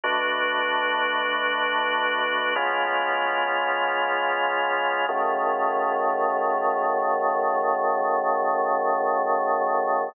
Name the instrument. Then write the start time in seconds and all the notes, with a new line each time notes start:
drawbar organ
0.04 B2 A3 D4 F#4
2.55 C#3 G#3 B3 F4
5.09 F#2 C#3 D#3 A3